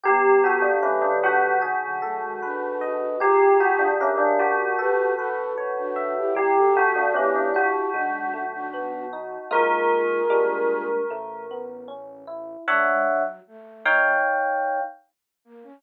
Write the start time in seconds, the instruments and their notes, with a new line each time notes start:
0.04 synth bass 1 G1, flute G3 B3, electric piano 1 G4, tubular bells G4
0.44 tubular bells F#4, electric piano 1 A4
0.62 tubular bells D4
0.83 flute F#3 A3, tubular bells C#4, electric piano 1 B4
1.02 flute D3 F#3, tubular bells D4
1.24 tubular bells F#4, electric piano 1 F#5
1.62 synth bass 1 B1, electric piano 1 G#4
1.82 flute D3 F#3
2.02 flute F#3 A3, electric piano 1 A4
2.22 flute D#3 G#3
2.42 flute D4 F#4, electric piano 1 B4
2.81 electric piano 1 D#5
3.20 synth bass 1 A#1, flute F4 G#4, electric piano 1 G4, tubular bells G4
3.60 tubular bells F#4, electric piano 1 G#4
3.79 tubular bells D4
4.01 tubular bells C#4, electric piano 1 A#4
4.18 tubular bells D4
4.39 synth bass 1 A1, tubular bells F#4, electric piano 1 D5
4.78 flute G4 B4, electric piano 1 A4
5.17 flute F#4 A4, electric piano 1 B4
5.58 electric piano 1 C#5
5.77 flute D4 F#4
5.96 electric piano 1 E5
6.16 flute E4 G4
6.35 synth bass 1 G1, electric piano 1 G3, flute E4 G4, tubular bells G4
6.56 flute F#4 A4
6.75 electric piano 1 A3, tubular bells F#4
6.96 tubular bells D4
7.14 electric piano 1 B3, tubular bells C#4, flute E4 G4
7.36 tubular bells D4
7.54 electric piano 1 F#4, tubular bells F#4
7.93 synth bass 1 B1, electric piano 1 G#3, flute D4 F#4
8.34 electric piano 1 A3
8.53 flute D4 F#4
8.74 electric piano 1 B3
9.13 electric piano 1 D#4
9.51 synth bass 1 A#1, electric piano 1 G#3 A#3 D#4 F4, flute F4 G#4, tubular bells A#4
10.30 synth bass 1 A#1, electric piano 1 G3 G#3 A#3 D4
11.11 synth bass 1 A1, electric piano 1 A3
11.51 electric piano 1 B3
11.88 electric piano 1 C#4
12.27 electric piano 1 E4
12.68 flute A3, electric piano 1 D4 C#5 E5 F#5
12.88 flute G#3
13.08 flute F#3
13.47 flute A3
13.86 electric piano 1 D#4 C#5 F5 G5
15.45 flute A#3
15.64 flute C#4